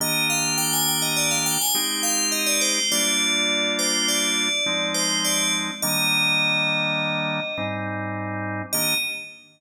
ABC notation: X:1
M:5/4
L:1/16
Q:1/4=103
K:Eb
V:1 name="Tubular Bells"
e2 f2 g a g e d f g a g2 f2 e d c2 | d6 c2 d6 c2 d2 z2 | e14 z6 | e4 z16 |]
V:2 name="Drawbar Organ"
[E,B,DG]12 [A,CEG]8 | [G,B,DF]12 [F,A,CE]8 | [E,G,B,D]12 [A,,G,CE]8 | [E,B,DG]4 z16 |]